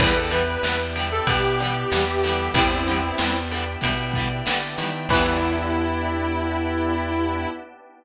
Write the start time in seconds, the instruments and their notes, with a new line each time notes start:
0.00 electric bass (finger) E2, harpsichord E2 E3, acoustic guitar (steel) D3 E3 G3, drawbar organ B3 D4 E4 G4, distortion guitar B4, string ensemble 1 B4 D5 E5 G5, kick, ride
0.06 acoustic guitar (steel) B3
0.16 distortion guitar A4
0.30 acoustic guitar (steel) D3 E3 G3, distortion guitar B4, ride
0.36 acoustic guitar (steel) B3
0.63 electric bass (finger) E2, acoustic guitar (steel) D3 E3 G3, distortion guitar B4, snare
0.69 acoustic guitar (steel) B3
0.96 acoustic guitar (steel) D3 E3 G3, ride
1.01 acoustic guitar (steel) B3
1.12 distortion guitar A4
1.27 electric bass (finger) B2, acoustic guitar (steel) D3 E3, distortion guitar G4, kick, ride
1.33 acoustic guitar (steel) G3 B3
1.60 acoustic guitar (steel) D3 E3 G3, ride
1.66 acoustic guitar (steel) B3
1.92 electric bass (finger) E2, acoustic guitar (steel) D3 E3 G3, snare
1.97 acoustic guitar (steel) B3
2.23 acoustic guitar (steel) D3 E3, snare, ride
2.27 acoustic guitar (steel) G3 B3
2.54 electric bass (finger) E2, harpsichord G2 G3, drawbar organ B3 D4 E4 G4, distortion guitar C4 E4, string ensemble 1 B4 D5 E5 G5, kick, ride
2.88 acoustic guitar (steel) D3 E3 G3, ride
2.93 acoustic guitar (steel) B3
3.18 electric bass (finger) E2, acoustic guitar (steel) D3 E3, snare
3.24 acoustic guitar (steel) G3 B3
3.51 acoustic guitar (steel) D3 E3, ride
3.56 acoustic guitar (steel) G3 B3
3.81 electric bass (finger) B2, acoustic guitar (steel) D3 E3 G3, kick, ride
3.87 acoustic guitar (steel) B3
4.13 acoustic guitar (steel) D3, kick, ride
4.18 acoustic guitar (steel) E3 G3 B3
4.46 acoustic guitar (steel) D3 E3 G3, electric bass (finger) D3, snare
4.51 acoustic guitar (steel) B3
4.78 acoustic guitar (steel) D3 E3 G3, electric bass (finger) D#3, snare, ride
4.83 acoustic guitar (steel) B3
5.09 electric bass (finger) E2, acoustic guitar (steel) D3 E3, harpsichord E3, drawbar organ B3 D4 E4 G4, string ensemble 1 B3 D4 E4 G4, distortion guitar E4, kick, crash
5.14 acoustic guitar (steel) G3 B3